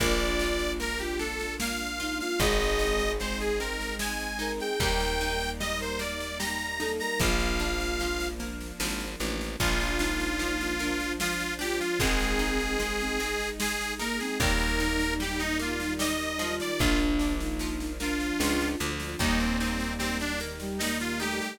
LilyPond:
<<
  \new Staff \with { instrumentName = "Accordion" } { \time 3/4 \key bes \major \tempo 4 = 75 d''4 bes'16 g'16 a'8 f''8. f''16 | ees''4 c''16 aes'16 bes'8 aes''8. g''16 | g''4 ees''16 c''16 d''8 bes''8. bes''16 | f''4. r4. |
f'2 f'8 g'16 f'16 | aes'2 aes'8 bes'16 aes'16 | bes'4 g'16 ees'16 f'8 ees''8. d''16 | f'16 r4 r16 f'4 r8 |
ees'16 c'16 c'8 c'16 d'16 r8 ees'16 f'16 g'16 g'16 | }
  \new Staff \with { instrumentName = "Choir Aahs" } { \time 3/4 \key bes \major f'4 r16 f'16 r4 ees'16 f'16 | aes'4 r16 aes'16 r4 bes'16 aes'16 | bes'4 r16 bes'16 r4 a'16 bes'16 | f'4. r4. |
r8 ees'4 d'8 r8 f'8 | c'4 r16 c'16 r4 bes16 c'16 | ees'2 ees'8 f'8 | d'8. ees'8. d'4 r8 |
bes4. r16 g16 bes8 a8 | }
  \new Staff \with { instrumentName = "Pizzicato Strings" } { \time 3/4 \key bes \major bes8 f'8 bes8 d'8 bes8 f'8 | aes8 ees'8 aes8 c'8 aes8 ees'8 | g8 ees'8 g8 bes8 g8 ees'8 | f8 d'8 f8 bes8 f8 d'8 |
f8 d'8 f8 bes8 f8 d'8 | aes8 ees'8 aes8 c'8 aes8 ees'8 | g8 ees'8 g8 bes8 g8 f8~ | f8 d'8 f8 bes8 f8 d'8 |
g8 ees'8 g8 bes8 g8 ees'8 | }
  \new Staff \with { instrumentName = "Electric Bass (finger)" } { \clef bass \time 3/4 \key bes \major bes,,2. | aes,,2. | ees,2. | bes,,2 aes,,8 a,,8 |
bes,,2. | aes,,2. | ees,2. | bes,,2 des,8 d,8 |
ees,2. | }
  \new Staff \with { instrumentName = "String Ensemble 1" } { \time 3/4 \key bes \major <bes d' f'>2. | <aes c' ees'>2. | <g bes ees'>2. | <f bes d'>2. |
<f bes d'>4. <f d' f'>4. | <aes c' ees'>4. <aes ees' aes'>4. | <g bes ees'>4. <ees g ees'>4. | <f bes d'>4. <f d' f'>4. |
<g bes ees'>4. <ees g ees'>4. | }
  \new DrumStaff \with { instrumentName = "Drums" } \drummode { \time 3/4 <bd sn>16 sn16 sn16 sn16 sn16 sn16 sn16 sn16 sn16 sn16 sn16 sn16 | <bd sn>16 sn16 sn16 sn16 sn16 sn16 sn16 sn16 sn16 sn16 sn16 sn16 | <bd sn>16 sn16 sn16 sn16 sn16 sn16 sn16 sn16 sn16 sn16 sn16 sn16 | <bd sn>16 sn16 sn16 sn16 sn16 sn16 sn16 sn16 sn16 sn16 sn16 sn16 |
<bd sn>16 sn16 sn16 sn16 sn16 sn16 sn16 sn16 sn16 sn16 sn16 sn16 | <bd sn>16 sn16 sn16 sn16 sn16 sn16 sn16 sn16 sn16 sn16 sn16 sn16 | <bd sn>16 sn16 sn16 sn16 sn16 sn16 sn16 sn16 sn16 sn16 sn16 sn16 | <bd sn>16 sn16 sn16 sn16 sn16 sn16 sn16 sn16 sn16 sn16 sn16 sn16 |
<bd sn>16 sn16 sn16 sn16 sn16 sn16 sn16 sn16 sn16 sn16 sn16 sn16 | }
>>